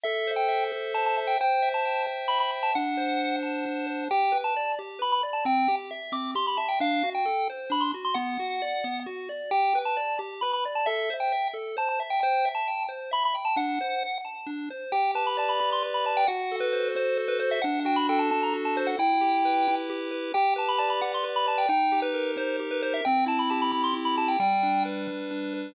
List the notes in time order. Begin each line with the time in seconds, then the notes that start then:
0.03 A4 E5
0.27 C5
0.36 G5
0.48 E5
0.72 A4
0.94 C5 A5
1.06 A5
1.17 E5
1.27 G5
1.41 C5 G5
1.62 E5
1.74 A5
1.85 G5
2.07 C5
2.28 E5 B5
2.40 B5
2.52 G5
2.63 A5
2.75 D4 F#5
2.97 C5
3.19 F#5
3.43 A5
3.66 D4
3.87 C5
4.11 G4 G5
4.32 B4
4.44 A5
4.56 D5
4.79 G4
4.99 B4 B5
5.12 B5
5.23 D5
5.33 A5
5.45 C4 G5
5.68 G4
5.91 E5
6.12 C4 D6
6.35 G4 C6
6.47 B5
6.57 E5 A5
6.69 G5
6.80 D4 F5
7.03 F#4
7.15 G5
7.25 A4
7.50 C5
7.70 D4 B5
7.81 C6
7.94 F#4
8.05 C6
8.14 B3 F#5
8.39 F#4
8.62 D5
8.84 B3
9.06 F#4
9.29 D5
9.51 G4 G5
9.75 B4
9.85 A5
9.97 D5
10.19 G4
10.41 B4 B5
10.53 B5
10.65 D5
10.75 A5
10.86 A4 E5
11.10 C5
11.20 G5
11.32 E5
11.54 A4
11.77 C5 A5
11.89 A5
12.00 E5
12.10 G5
12.20 C5 G5
12.45 E5
12.55 A5
12.68 G5
12.89 C5
13.11 E5 B5
13.25 B5
13.35 G5
13.45 A5
13.56 D4 F#5
13.81 C5
14.03 F#5
14.25 A5
14.47 D4
14.70 C5
14.92 G4 G5
15.15 B4 A5
15.27 B5
15.37 D5 A5
15.49 B5
15.59 G4 B5
15.72 C6
15.83 B4
15.94 B5
16.05 D5 A5
16.17 G5
16.27 F#4 F#5
16.52 A4
16.60 B4
16.73 C5
16.95 F#4 C5
17.17 A4
17.28 B4
17.40 C5
17.51 E5
17.62 D4 F#5
17.85 F#4 G5
17.96 B5
18.09 A4 G5
18.19 A5
18.31 D4 A5
18.43 A#5
18.53 F#4
18.65 A5
18.77 A4 C5
18.87 F#5
18.99 E4 G5
19.21 G4
19.45 B4
19.68 E4
19.90 G4
20.11 B4
20.34 G4 G5
20.56 B4 A5
20.69 B5
20.78 D5 A5
20.90 B5
21.02 G4 F#5
21.14 C6
21.24 B4
21.36 B5
21.47 D5 A5
21.58 G5
21.69 D#4 G5
21.92 G4
22.02 B4
22.14 A#4
22.37 D#4 C5
22.59 G4
22.71 B4
22.83 A#4 C5
22.94 E5
23.05 C4 G5
23.26 E4 A5
23.39 B5
23.50 G4 A5
23.62 B5
23.72 C4 B5
23.84 C6
23.94 E4
24.05 B5
24.18 G4 A5
24.28 G5
24.40 G3 G5
24.63 D4
24.85 B4
25.08 G3
25.31 D4
25.54 B4